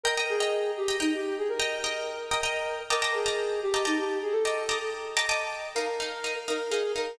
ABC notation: X:1
M:3/4
L:1/16
Q:1/4=126
K:Eb
V:1 name="Flute"
B2 A4 G2 E G2 A | B12 | B2 A4 G2 E G2 ^G | =A4 z8 |
B6 B2 A2 B2 |]
V:2 name="Orchestral Harp"
[egb] [egb]2 [egb]4 [egb] [egb]4- | [egb] [egb]2 [egb]4 [egb] [egb]4 | [eg=abd'] [egabd']2 [egabd']4 [egabd'] [egabd']4- | [eg=abd'] [egabd']2 [egabd']4 [egabd'] [egabd']4 |
[Efb]2 [Efb]2 [Efb]2 [Efb]2 [Efb]2 [Efb]2 |]